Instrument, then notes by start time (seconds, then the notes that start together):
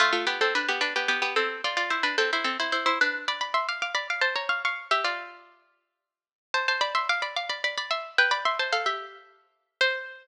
harpsichord
0.00 A3 F4
0.13 A3 F4
0.27 B3 G4
0.41 C4 A4
0.55 D4 B4
0.69 B3 G4
0.81 D4 B4
0.96 B3 G4
1.08 B3 G4
1.22 B3 G4
1.36 C4 A4
1.64 F4 D5
1.77 F4 D5
1.90 E4 C5
2.03 D4 B4
2.18 C4 A4
2.33 E4 C5
2.44 C4 A4
2.60 E4 C5
2.72 E4 C5
2.86 E4 C5
3.01 D4 B4
3.28 D5 B5
3.41 D5 B5
3.54 E5 C6
3.69 F5 D6
3.82 F5 D6
3.95 D5 B5
4.10 F5 D6
4.21 C5 A5
4.36 C#5 A#5
4.49 F5 C#6
4.65 F5 C#6
4.91 G4 E5
5.04 F4 D5
6.54 C5 A5
6.68 C5 A5
6.81 D5 B5
6.95 E5 C6
7.09 F5 D6
7.22 D5 B5
7.36 F5 D6
7.49 D5 B5
7.64 D5 B5
7.78 D5 B5
7.91 E5 C6
8.18 B4 G5
8.31 D5 B5
8.45 E5 C6
8.59 C5 A5
8.73 A4 F5
8.86 G4 E5
9.81 C5